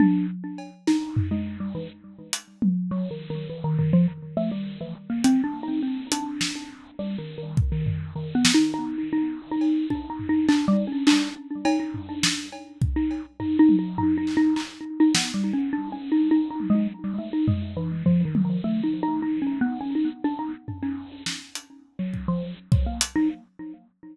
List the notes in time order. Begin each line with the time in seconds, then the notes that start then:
0.00 D4, high tom
0.58 cowbell
0.87 D#4, snare
1.17 floor tom
1.31 G#3
1.60 G3
1.75 E3
2.33 closed hi-hat
2.62 high tom
2.91 F#3
3.11 D#3
3.30 D#3
3.50 E3
3.64 D#3
3.79 D#3, floor tom
3.93 F3
4.37 A3
4.51 G3
4.81 E3
5.10 A#3
5.24 C4, closed hi-hat
5.44 D4
5.63 D#4
5.83 C4
6.12 D4, closed hi-hat
6.41 snare
6.99 G3
7.18 D#3
7.38 D#3
7.57 kick
7.72 D#3
7.86 floor tom
8.16 D#3
8.35 B3
8.45 snare
8.54 D#4
8.74 D#4
9.13 D#4
9.51 D#4
9.61 cowbell
9.90 D4, kick
10.10 D#4
10.19 floor tom
10.29 D#4
10.49 D4, clap
10.68 G3
10.87 C#4
11.07 D4, clap
11.65 D#4, cowbell
11.80 D#4
11.94 floor tom
12.09 D4
12.23 snare
12.52 cowbell
12.82 kick
12.96 D#4
13.11 cowbell
13.40 D#4, floor tom
13.59 D#4
13.69 high tom
13.79 D#4
13.98 D#4, floor tom
14.17 D#4
14.27 clap
14.37 D#4
14.56 D#4, clap
15.00 D#4
15.15 B3, snare
15.34 G3
15.53 C#4
15.73 D4
15.92 C#4
16.12 D#4
16.31 D#4
16.50 D#4
16.60 high tom
16.70 G#3
17.04 G3
17.18 A3
17.33 D#4
17.48 G#3, floor tom
17.77 E3
18.06 F3, floor tom
18.25 D#3
18.35 high tom
18.45 D#3
18.64 A3
18.83 D#4
19.03 D#4
19.22 D#4
19.42 C#4
19.61 B3
19.81 C#4
19.95 D#4
20.24 D4
20.39 D#4
20.68 floor tom
20.83 C#4
21.26 snare
21.55 closed hi-hat
21.99 F#3
22.14 kick
22.28 F3
22.72 F#3, kick
22.86 A#3
23.01 closed hi-hat
23.16 D#4